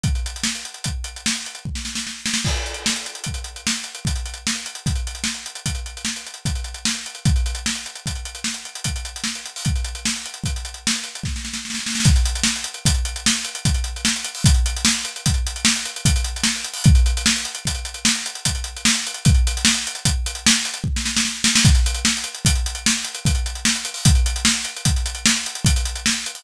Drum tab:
CC |------------------------------------------------|x-----------------------------------------------|------------------------------------------------|------------------------------------------------|
HH |x-x-x-x---x-x-x-x---x-x---x-x-x-----------------|--x-x-x---x-x-x-x-x-x-x---x-x-x-x-x-x-x---x-x-x-|x-x-x-x---x-x-x-x-x-x-x---x-x-x-x-x-x-x---x-x-x-|x-x-x-x---x-x-x-x-x-x-x---x-x-x-x-x-x-x---x-x-o-|
SD |--------o---------------o---------o-o-o-o---o-o-|--------o---------------o---------------o-------|--------o---------------o---------------o-------|--------o---------------o---------------o-------|
BD |o---------------o---------------o---------------|o---------------o---------------o---------------|o---------------o---------------o---------------|o---------------o---------------o---------------|

CC |------------------------------------------------|------------------------------------------------|------------------------------------------------|------------------------------------------------|
HH |x-x-x-x---x-x-x-x-x-x-x---x-x-x-----------------|x-x-x-x---x-x-x-x-x-x-x---x-x-x-x-x-x-x---x-x-o-|x-x-x-x---x-x-x-x-x-x-x---x-x-x-x-x-x-x---x-x-o-|x-x-x-x---x-x-x-x-x-x-x---x-x-x-x-x-x-x---x-x-x-|
SD |--------o---------------o-------o-o-o-o-oooooooo|--------o---------------o---------------o-------|--------o---------------o---------------o-------|--------o---------------o---------------o-------|
BD |o---------------o---------------o---------------|o---------------o---------------o---------------|o---------------o---------------o---------------|o---------------o---------------o---------------|

CC |------------------------------------------------|------------------------------------------------|------------------------------------------------|
HH |x-x-x-x---x-x-x-x---x-x---x-x-x-----------------|x-x-x-x---x-x-x-x-x-x-x---x-x-x-x-x-x-x---x-x-o-|x-x-x-x---x-x-x-x-x-x-x---x-x-x-x-x-x-x---x-x-o-|
SD |--------o---------------o---------o-o-o-o---o-o-|--------o---------------o---------------o-------|--------o---------------o---------------o-------|
BD |o---------------o---------------o---------------|o---------------o---------------o---------------|o---------------o---------------o---------------|